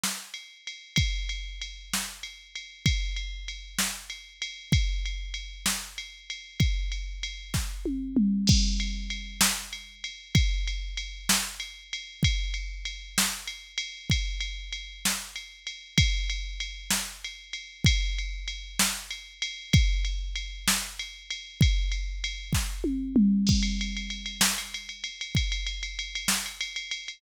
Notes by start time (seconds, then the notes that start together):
0.04 snare
0.34 ride
0.67 ride
0.96 kick, ride
1.29 ride
1.61 ride
1.93 snare
2.23 ride
2.55 ride
2.86 kick, ride
3.16 ride
3.48 ride
3.79 snare
4.10 ride
4.42 ride
4.72 kick, ride
5.05 ride
5.34 ride
5.66 snare
5.98 ride
6.30 ride
6.60 kick, ride
6.92 ride
7.23 ride
7.54 kick, snare
7.85 high tom
8.17 mid tom
8.47 kick, crash
8.80 ride
9.10 ride
9.41 snare
9.73 ride
10.04 ride
10.35 kick, ride
10.67 ride
10.97 ride
11.29 snare
11.60 ride
11.93 ride
12.23 kick, ride
12.54 ride
12.85 ride
13.18 snare
13.47 ride
13.78 ride
14.10 kick, ride
14.40 ride
14.73 ride
15.05 snare
15.36 ride
15.67 ride
15.98 kick, ride
16.30 ride
16.60 ride
16.90 snare
17.24 ride
17.53 ride
17.84 kick, ride
18.18 ride
18.48 ride
18.79 snare
19.11 ride
19.42 ride
19.73 kick, ride
20.05 ride
20.36 ride
20.68 snare
20.99 ride
21.30 ride
21.61 kick, ride
21.92 ride
22.24 ride
22.53 kick, snare
22.84 high tom
23.16 mid tom
23.47 kick, crash
23.63 ride
23.81 ride
23.97 ride
24.10 ride
24.26 ride
24.41 snare
24.58 ride
24.74 ride
24.89 ride
25.04 ride
25.21 ride
25.35 kick, ride
25.52 ride
25.67 ride
25.83 ride
25.99 ride
26.15 ride
26.28 snare
26.46 ride
26.61 ride
26.76 ride
26.91 ride
27.08 ride